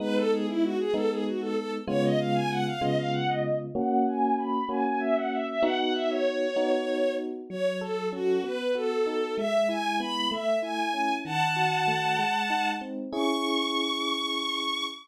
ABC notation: X:1
M:6/8
L:1/16
Q:3/8=64
K:E
V:1 name="Violin"
B A G E F G A G F A A z | c d ^e g f e d e f d d z | f2 g2 b2 g g e f e e | f f e c7 z2 |
[K:C#m] c2 A2 F2 B2 A4 | e2 g2 b2 e2 g4 | [fa]10 z2 | c'12 |]
V:2 name="Electric Piano 1"
[G,B,D]6 [G,B,D]6 | [C,G,B,^E]6 [C,G,B,E]6 | [^A,CF]6 [A,CF]6 | [B,DF]6 [B,DF]6 |
[K:C#m] F,2 A2 C2 B,2 F2 D2 | G,2 E2 B,2 A,2 E2 C2 | D,2 F2 A,2 G,2 D2 ^B,2 | [CEG]12 |]